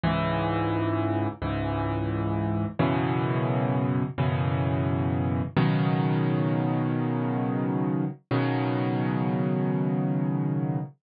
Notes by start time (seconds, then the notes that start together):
0.03 C#2 G#2 E3
1.42 C#2 G#2 E3
2.79 F#2 B2 C#3 E3
4.18 F#2 B2 C#3 E3
5.56 B2 C#3 D#3 F#3
8.31 B2 C#3 D#3 F#3